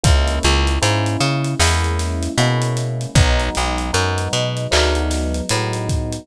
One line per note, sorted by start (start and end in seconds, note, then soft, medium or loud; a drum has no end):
0.03 0.39 C#2 medium
0.03 0.75 G#3 loud
0.03 0.75 A#3 loud
0.03 0.75 C#4 loud
0.03 0.75 E4 loud
0.03 kick medium
0.03 closed hi-hat loud
0.27 closed hi-hat medium
0.43 0.79 C#2 medium
0.43 closed hi-hat medium
0.67 closed hi-hat medium
0.81 1.17 G#2 medium
0.81 1.53 G#3 medium
0.81 1.53 A#3 medium
0.81 1.53 C#4 medium
0.81 1.53 E4 medium
0.81 closed hi-hat medium
1.06 closed hi-hat medium
1.20 1.55 C#3 medium
1.20 closed hi-hat medium
1.44 closed hi-hat medium
1.59 2.28 E2 medium
1.59 2.31 G#3 medium
1.59 2.31 A#3 medium
1.59 2.31 C#4 medium
1.59 2.31 E4 loud
1.59 snare medium
1.84 closed hi-hat medium
1.99 snare soft
1.99 closed hi-hat medium
2.23 closed hi-hat medium
2.38 3.06 B2 medium
2.38 3.11 G#3 medium
2.38 3.11 A#3 medium
2.38 3.11 C#4 medium
2.38 3.11 E4 medium
2.38 closed hi-hat medium
2.62 closed hi-hat medium
2.77 closed hi-hat medium
3.01 closed hi-hat medium
3.15 3.50 B1 loud
3.15 3.89 F#3 loud
3.15 3.89 G#3 loud
3.15 3.89 B3 loud
3.15 3.89 D#4 loud
3.15 kick loud
3.15 closed hi-hat medium
3.39 closed hi-hat medium
3.55 3.91 B1 medium
3.55 snare soft
3.55 closed hi-hat medium
3.78 closed hi-hat medium
3.93 4.28 F#2 medium
3.93 4.65 F#3 medium
3.93 4.65 G#3 medium
3.93 4.65 B3 medium
3.93 4.65 D#4 medium
3.93 closed hi-hat medium
4.18 closed hi-hat medium
4.33 4.67 B2 medium
4.33 closed hi-hat medium
4.57 closed hi-hat medium
4.71 5.42 D2 medium
4.71 5.43 F#3 loud
4.71 5.43 G#3 medium
4.71 5.43 B3 loud
4.71 5.43 D#4 loud
4.71 clap loud
4.95 closed hi-hat medium
5.11 snare medium
5.11 closed hi-hat medium
5.34 closed hi-hat medium
5.49 6.19 A2 medium
5.49 6.23 F#3 medium
5.49 6.23 G#3 medium
5.49 6.23 B3 medium
5.49 6.23 D#4 medium
5.49 closed hi-hat medium
5.73 closed hi-hat medium
5.89 kick medium
5.89 closed hi-hat medium
6.12 closed hi-hat medium